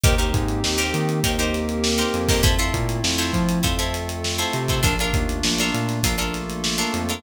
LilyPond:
<<
  \new Staff \with { instrumentName = "Acoustic Guitar (steel)" } { \time 4/4 \key c \dorian \tempo 4 = 100 <ees' g' bes' c''>16 <ees' g' bes' c''>4 <ees' g' bes' c''>8. <ees' g' bes' c''>16 <ees' g' bes' c''>4 <ees' g' bes' c''>8 <ees' g' bes' c''>16 | <e' f' a' c''>16 <e' f' a' c''>4 <e' f' a' c''>8. <e' f' a' c''>16 <e' f' a' c''>4 <e' f' a' c''>8 <e' f' a' c''>16 | <d' f' a' bes'>16 <d' f' a' bes'>4 <d' f' a' bes'>8. <d' f' a' bes'>16 <d' f' a' bes'>4 <d' f' a' bes'>8 <d' f' a' bes'>16 | }
  \new Staff \with { instrumentName = "Synth Bass 1" } { \clef bass \time 4/4 \key c \dorian ees,8 aes,8 ees,8 ees8 ees,4. f,8~ | f,8 bes,8 f,8 f8 f,4. c8 | bes,,8 ees,8 bes,,8 bes,8 bes,,4. f,8 | }
  \new Staff \with { instrumentName = "Pad 5 (bowed)" } { \time 4/4 \key c \dorian <bes c' ees' g'>2 <bes c' g' bes'>2 | <a c' e' f'>2 <a c' f' a'>2 | <a bes d' f'>2 <a bes f' a'>2 | }
  \new DrumStaff \with { instrumentName = "Drums" } \drummode { \time 4/4 <hh bd>16 hh16 <hh bd>16 hh16 sn16 <hh sn>16 hh16 hh16 <hh bd>16 hh16 <hh sn>16 hh16 sn16 hh16 hh16 <hho bd>16 | <hh bd>16 hh16 <hh bd>16 hh16 sn16 <hh sn>16 <hh bd>16 hh16 <hh bd>16 hh16 <hh sn>16 hh16 sn16 hh16 hh16 <hh bd>16 | <hh bd>16 hh16 <hh bd>16 hh16 sn16 <hh sn>16 hh16 <hh sn>16 <hh bd>16 hh16 <hh sn>16 hh16 sn16 hh16 hh16 hh16 | }
>>